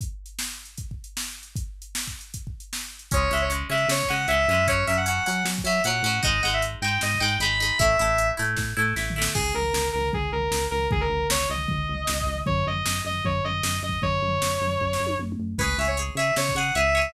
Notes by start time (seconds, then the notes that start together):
0.01 kick, closed hi-hat
0.26 closed hi-hat
0.39 snare
0.65 closed hi-hat
0.77 kick, closed hi-hat
0.91 kick
1.04 closed hi-hat
1.17 snare
1.43 closed hi-hat
1.56 kick, closed hi-hat
1.82 closed hi-hat
1.95 snare
2.07 kick
2.21 closed hi-hat
2.34 kick, closed hi-hat
2.47 kick
2.60 closed hi-hat
2.73 snare
2.99 closed hi-hat
3.11 C#2 G#3 C#4 C#5, kick, closed hi-hat
3.31 C#2 G#3 C#4 E5
3.37 closed hi-hat
3.41 C#5
3.50 G#3 C#4, closed hi-hat
3.69 C#3 G#3 C#4 E5
3.77 closed hi-hat
3.88 C#3 C#5, snare
4.03 kick
4.09 C#3 G#3 C#4 F#5
4.16 closed hi-hat
4.28 C#2 G#3 C#4 E5, closed hi-hat
4.48 F#2 G#3 C#4
4.54 closed hi-hat
4.68 F#3 C#4 C#5, kick, closed hi-hat
4.87 F#2 F#3 C#4 E5
4.94 F#5, closed hi-hat
5.06 F#3 C#4 F#5, closed hi-hat
5.26 F#3 C#4 F#5
5.33 closed hi-hat
5.45 F#3, snare
5.58 kick
5.64 F#3 C#4 E5
5.71 closed hi-hat
5.84 A#2 F#3 C#4 F#5, closed hi-hat
6.03 A2 F#3 C#4
6.10 closed hi-hat
6.23 G#1 G#3 D#4 D#5, kick, closed hi-hat
6.42 G#1 G#3 D#4 F#5
6.50 E5, closed hi-hat
6.62 closed hi-hat
6.82 G#2 G#3 D#4 G5
6.88 closed hi-hat
7.01 G#2 D#5, snare
7.15 kick
7.20 G#2 G#3 D#4 G5
7.28 closed hi-hat
7.39 G#1 G#3 D#4 B5, closed hi-hat
7.60 G#3 D#4
7.66 closed hi-hat
7.79 A1 A3 E4 E5, kick, closed hi-hat
7.99 A1 A3 E4
8.05 closed hi-hat
8.18 closed hi-hat
8.37 A2 A3 E4
8.44 closed hi-hat
8.57 A2, kick, snare
8.77 A2 A3 E4
8.96 A1 A3 E4, snare
9.10 floor tom
9.16 A3 E4
9.22 snare
9.35 C#2 G#4, kick, crash
9.54 C#2 A#4
9.62 floor tom
9.74 C#2, snare
9.93 C#2 A#4
9.99 floor tom
10.13 C#2 G#4, kick, floor tom
10.32 C#2 A#4
10.39 floor tom
10.51 C#2, snare
10.71 C#2 A#4
10.78 floor tom
10.91 C#2 G#4, kick, floor tom
11.01 A#4
11.09 C#2
11.17 floor tom
11.30 C#2 C#5, snare
11.50 C#2 D#5
11.55 floor tom
11.68 C#2, kick, floor tom
11.89 C#2
11.94 floor tom
12.07 C#2, snare
12.21 kick
12.26 C#2
12.34 floor tom
12.46 F#2 C#5, kick, floor tom
12.66 F#2 D#5
12.73 floor tom
12.85 F#2, snare
13.05 F#2 D#5
13.11 floor tom
13.24 F#2 C#5, kick, floor tom
13.44 F#2 D#5
13.50 floor tom
13.63 F#2, snare
13.82 F#2 D#5
13.89 kick, floor tom
14.02 F#2 C#5, kick, floor tom
14.22 F#2
14.28 floor tom
14.42 F#2, snare
14.61 F#2
14.68 floor tom
14.81 F#2, kick
14.93 snare
15.00 F#2
15.06 high tom
15.19 F#2, mid tom
15.32 mid tom
15.39 F#2
15.58 C#2 G#4 B4 C#5, kick, crash
15.77 C#2 G#4 C#5 E5
15.85 C#5, closed hi-hat
15.97 G#4 C#5, closed hi-hat
16.15 C#3 G#4 C#5 E5
16.24 closed hi-hat
16.36 C#3 C#5, snare
16.49 kick
16.55 C#3 G#4 C#5 F#5
16.62 closed hi-hat
16.75 C#2 G#4 C#5 E5, closed hi-hat
16.95 G#4 C#5
17.01 closed hi-hat